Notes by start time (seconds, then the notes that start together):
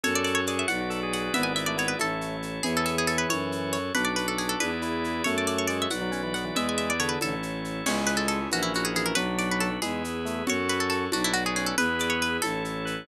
0.03 F#2 F#4 A4 C#5, low conga, shaker
0.15 D5
0.24 D5, shaker
0.35 C#5
0.47 G#4 D5, shaker
0.59 E5
0.68 B1 F#4 B4 D5 F#5, high conga, shaker
0.81 F#4
0.90 A4, shaker
1.03 G#4
1.13 G#4 F#5, shaker
1.23 G#4
1.34 G#1 B3 E4 G#4 B4 D5 E5, low conga, shaker
1.43 G#5
1.56 E5, shaker
1.66 A3 D5
1.77 B3 C#5, shaker
1.88 B4
1.99 A1 A3 E4 A4 C#5, high conga, shaker
2.21 shaker
2.42 shaker
2.63 E2 E3 E4 G#4 C#5, low conga, shaker
2.77 A4
2.86 A4, shaker
2.98 G#4
3.07 A4, shaker
3.18 B4
3.29 F#2 F#4 A4 C#5, high conga, shaker
3.52 shaker
3.73 C#5, shaker
3.95 B1 D4 F#4 B4 D5, low conga, shaker
4.05 D5
4.16 B4, shaker
4.28 A4
4.38 G#4, shaker
4.49 A4
4.60 E2 E4 G#4 B4 D5, high conga, shaker
4.82 E4, shaker
5.04 shaker
5.24 F#2 A3 F#4 A4 C#5, low conga, shaker
5.38 D5
5.47 D5, shaker
5.58 C#5
5.67 G#3 D5, shaker
5.82 E5
5.90 B1 F#4 B4 D5 F#5, high conga, shaker
6.01 F#3
6.12 C#4, shaker
6.23 E3
6.34 B3 F#5, shaker
6.45 E3
6.55 E2 G#3 E4 G#4 B4 D5 E5, low conga, shaker
6.69 G#5
6.78 E5, shaker
6.90 D5
6.99 D3 C#5, shaker
7.09 B4
7.21 A1 E4 A4 C#5, high conga, shaker
7.43 shaker
7.64 shaker
7.86 C#2 G#3 C#4 E4 G#4 C#5, crash, low conga, shaker
8.07 B4, shaker
8.17 A4
8.28 A4, shaker
8.51 A#1 E3 C#4 E4 F#4 A#4, high conga, shaker
8.63 E4
8.74 F#4, shaker
8.85 G#4
8.94 E3 G#4, shaker
9.06 A#4
9.15 B1 F#3 D4 F#4 B4, low conga, shaker
9.38 D5, shaker
9.51 B4
9.60 A4, shaker
9.82 E2 G#3 E4 G#4 B4, high conga, shaker
10.04 shaker
10.25 A3, shaker
10.47 F#2 F#4 A4 C#5, low conga, shaker
10.68 B4, shaker
10.80 A4
10.90 A4, shaker
11.12 B1 D4 F#4 B4 D5, high conga, shaker
11.24 E4
11.34 F#4, shaker
11.46 G#4
11.56 C#4 G#4, shaker
11.66 A4
11.78 E2 E4 G#4 B4, low conga, shaker
11.99 D5, shaker
12.10 C#5
12.22 B4, shaker
12.42 A1 E4 A4 C#5, high conga, shaker
12.65 shaker
12.85 B4, shaker